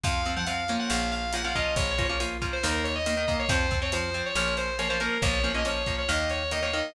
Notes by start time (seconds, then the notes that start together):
0.04 F2 F3 C4 F5, kick, closed hi-hat
0.26 F3 C4, closed hi-hat
0.37 F3 C4 F#5
0.47 F3 C4 F5, closed hi-hat
0.68 F3 A#3 C#4, closed hi-hat
0.79 F#5
0.90 A#1 F5, snare
1.12 F5, closed hi-hat
1.33 F3 A#3 C#4 F#5, closed hi-hat
1.44 F3 A#3 C#4 F5
1.55 F3 A#3 C#4 D#5, kick, closed hi-hat
1.76 A#1 C#5, kick, closed hi-hat
1.91 C#5
1.98 F3 A#3 C#4, kick, closed hi-hat
2.05 F3 A#3 C#4 C#5
2.20 F3 A#3 C#4, closed hi-hat
2.42 F3 A#3 C#4, kick, closed hi-hat
2.53 C5
2.63 D#2 D#3 A#3 A#4, snare
2.84 C#5, closed hi-hat
2.95 D#5
3.06 D#3 A#3, closed hi-hat
3.17 D#3 A#3
3.28 D#3 A#3, kick, closed hi-hat
3.39 C#5
3.49 F2 F3 C4 C5, kick, closed hi-hat
3.71 F3 C4, kick, closed hi-hat
3.82 F3 C4 C#5
3.92 F3 C4 C5, closed hi-hat
4.14 F3 C4, closed hi-hat
4.26 C#5
4.35 A#1 F3 A#3 C#4 C#5, snare
4.57 C5, closed hi-hat
4.78 F3 A#3 C#4 C#5, closed hi-hat
4.89 F3 A#3 C#4 C5
5.00 F3 A#3 C#4 A#4, closed hi-hat
5.22 A#1 F3 A#3 C#4 C#5, kick, closed hi-hat
5.44 F3 A#3 C#4, closed hi-hat
5.54 F3 A#3 C#4 D#5
5.65 F3 A#3 C#4 C#5, closed hi-hat
5.86 F3 A#3 C#4, kick, closed hi-hat
5.98 C#5
6.09 D#2 D#3 A#3 D#5, snare
6.30 C#5, closed hi-hat
6.51 D#3 A#3 D#5, closed hi-hat
6.62 D#3 A#3 C#5
6.73 D#3 A#3 D#5, closed hi-hat